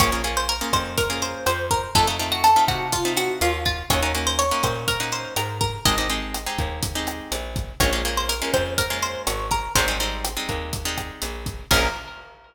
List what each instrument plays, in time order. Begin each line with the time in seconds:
0.00 electric bass (finger) A#1, acoustic guitar (steel) A#3 C#4 F4 G#4 C#5, kick, cross-stick, closed hi-hat
0.12 acoustic guitar (steel) A#3 C#4 F4 G#4
0.24 acoustic guitar (steel) A#3 C#4 F4 G#4, closed hi-hat
0.37 acoustic guitar (steel) C5
0.49 acoustic guitar (steel) A#4
0.61 acoustic guitar (steel) A#3 C#4 F4 G#4
0.73 electric bass (finger) F2, acoustic guitar (steel) C5, kick, cross-stick, closed hi-hat
0.98 acoustic guitar (steel) A#4, kick, closed hi-hat
1.10 acoustic guitar (steel) A#3 C#4 F4 G#4
1.22 acoustic guitar (steel) C5, closed hi-hat
1.46 electric bass (finger) F2, acoustic guitar (steel) C5, cross-stick, closed hi-hat
1.71 acoustic guitar (steel) A#4, kick, closed hi-hat
1.95 electric bass (finger) F2, acoustic guitar (steel) A3 C4 D#4 F4 A4, kick, closed hi-hat
2.07 acoustic guitar (steel) A3 C4 D#4 F4
2.19 acoustic guitar (steel) A3 C4 D#4 F4, closed hi-hat
2.32 acoustic guitar (steel) F#4
2.44 acoustic guitar (steel) A4, cross-stick, closed hi-hat
2.56 acoustic guitar (steel) A3 C4 D#4 F4
2.68 electric bass (finger) C3, acoustic guitar (steel) F#4, kick, closed hi-hat
2.92 acoustic guitar (steel) F4, kick, closed hi-hat
3.05 acoustic guitar (steel) A3 C4 D#4 F4
3.17 acoustic guitar (steel) F#4, cross-stick, closed hi-hat
3.41 electric bass (finger) D#2, acoustic guitar (steel) F4, closed hi-hat
3.65 acoustic guitar (steel) F4, kick, closed hi-hat
3.90 electric bass (finger) D#2, acoustic guitar (steel) A#3 C#4 D#4 F#4 C#5, kick, cross-stick, closed hi-hat
4.02 acoustic guitar (steel) A#3 C#4 D#4 F#4
4.15 acoustic guitar (steel) A#3 C#4 D#4 F#4, closed hi-hat
4.27 acoustic guitar (steel) C5
4.39 acoustic guitar (steel) C#5, closed hi-hat
4.51 acoustic guitar (steel) A#3 C#4 D#4 F#4
4.63 electric bass (finger) A#2, acoustic guitar (steel) C5, kick, cross-stick, closed hi-hat
4.88 acoustic guitar (steel) A#4, kick, closed hi-hat
5.00 acoustic guitar (steel) A#3 C#4 D#4 F#4
5.12 acoustic guitar (steel) C5, closed hi-hat
5.36 electric bass (finger) G#2, acoustic guitar (steel) A#4, cross-stick, closed hi-hat
5.61 acoustic guitar (steel) A#4, kick, closed hi-hat
5.85 electric bass (finger) G#1, acoustic guitar (steel) G#3 C4 D#4 G4 D#5, kick, closed hi-hat
5.98 acoustic guitar (steel) G#3 C4 D#4 G4
6.10 acoustic guitar (steel) G#3 C4 D#4 G4, closed hi-hat
6.34 cross-stick, closed hi-hat
6.46 acoustic guitar (steel) G#3 C4 D#4 G4
6.58 electric bass (finger) D#2, kick, closed hi-hat
6.83 kick, closed hi-hat
6.95 acoustic guitar (steel) G#3 C4 D#4 G4
7.07 cross-stick, closed hi-hat
7.32 electric bass (finger) A#1, closed hi-hat
7.56 kick, closed hi-hat
7.80 electric bass (finger) A#1, acoustic guitar (steel) G#3 A#3 C#4 F4 C#5, kick, cross-stick, closed hi-hat
7.93 acoustic guitar (steel) G#3 A#3 C#4 F4
8.05 acoustic guitar (steel) G#3 A#3 C#4 F4, closed hi-hat
8.17 acoustic guitar (steel) C5
8.29 acoustic guitar (steel) A#4, closed hi-hat
8.42 acoustic guitar (steel) G#3 A#3 C#4 F4
8.54 electric bass (finger) F2, acoustic guitar (steel) C5, kick, cross-stick, closed hi-hat
8.78 acoustic guitar (steel) A#4, kick, closed hi-hat
8.90 acoustic guitar (steel) G#3 A#3 C#4 F4
9.02 acoustic guitar (steel) C5, closed hi-hat
9.27 electric bass (finger) G#1, acoustic guitar (steel) C#5, cross-stick, closed hi-hat
9.51 acoustic guitar (steel) A#4, kick, closed hi-hat
9.75 electric bass (finger) G#1, acoustic guitar (steel) G3 G#3 C4 D#4 C5, kick, closed hi-hat
9.88 acoustic guitar (steel) G3 G#3 C4 D#4
10.00 acoustic guitar (steel) G3 G#3 C4 D#4, closed hi-hat
10.24 cross-stick, closed hi-hat
10.37 acoustic guitar (steel) G3 G#3 C4 D#4
10.49 electric bass (finger) D#2, kick, closed hi-hat
10.73 kick, closed hi-hat
10.85 acoustic guitar (steel) G3 G#3 C4 D#4
10.98 kick, cross-stick, closed hi-hat
11.22 electric bass (finger) A#1, closed hi-hat
11.46 kick, closed hi-hat
11.71 electric bass (finger) A#1, acoustic guitar (steel) A#3 C#4 F4 G#4 A#4, kick, crash